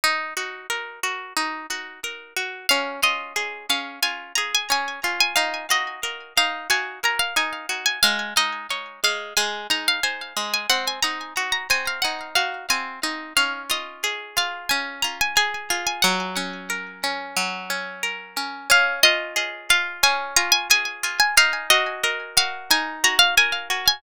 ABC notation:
X:1
M:4/4
L:1/16
Q:1/4=90
K:Db
V:1 name="Orchestral Harp"
z16 | f2 e4 f2 a2 b a a3 a | f2 e4 f2 a2 b f a3 a | f2 e4 f2 a2 b f a3 a |
g a b3 b a f g2 f2 a2 z2 | f2 e4 f2 a2 b a a3 a | g8 z8 | f2 e4 f2 a2 b a a3 a |
f2 e4 f2 a2 b f a3 a |]
V:2 name="Orchestral Harp"
E2 G2 B2 G2 E2 G2 B2 G2 | D2 F2 A2 D2 F2 A2 D2 F2 | E2 G2 B2 E2 G2 B2 E2 G2 | A,2 E2 d2 A,2 A,2 E2 c2 A,2 |
C2 E2 G2 C2 E2 G2 C2 E2 | D2 F2 A2 F2 D2 F2 A2 F2 | G,2 D2 B2 D2 G,2 D2 B2 D2 | D2 F2 A2 F2 D2 F2 A2 F2 |
E2 G2 B2 G2 E2 G2 B2 G2 |]